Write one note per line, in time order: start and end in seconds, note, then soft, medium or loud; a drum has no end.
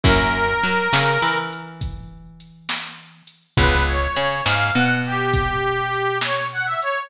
0.03 0.55 F#2 loud
0.03 0.45 A#3 medium
0.03 0.45 C#4 medium
0.03 0.45 E4 medium
0.03 0.45 F#4 medium
0.03 1.38 A#4 loud
0.03 kick loud
0.03 closed hi-hat medium
0.63 0.88 F#3 medium
0.63 0.89 F#4 medium
0.63 closed hi-hat medium
0.93 1.18 C#3 medium
0.93 1.18 C#4 medium
0.93 snare loud
1.22 3.22 E3 medium
1.22 3.22 E4 medium
1.52 closed hi-hat medium
1.81 kick medium
1.81 closed hi-hat medium
2.40 closed hi-hat medium
2.69 snare medium
3.27 closed hi-hat medium
3.57 4.07 C#2 loud
3.57 3.99 G#3 medium
3.57 3.99 B3 medium
3.57 3.99 C#4 medium
3.57 3.99 F4 medium
3.57 3.84 B4 medium
3.57 kick loud
3.57 closed hi-hat medium
3.87 4.43 C#5 medium
4.16 4.41 C#3 medium
4.16 4.42 C#4 medium
4.16 closed hi-hat medium
4.45 4.71 G#2 medium
4.45 4.71 G#3 medium
4.45 4.72 F5 medium
4.45 snare medium
4.74 6.75 B2 loud
4.74 6.75 B3 medium
4.74 4.98 F#5 medium
5.05 6.18 G4 medium
5.05 closed hi-hat medium
5.33 kick medium
5.33 closed hi-hat loud
5.93 closed hi-hat medium
6.21 6.47 C#5 medium
6.21 snare medium
6.52 6.66 F#5 medium
6.66 6.80 E5 medium
6.81 7.09 C#5 loud
6.81 closed hi-hat medium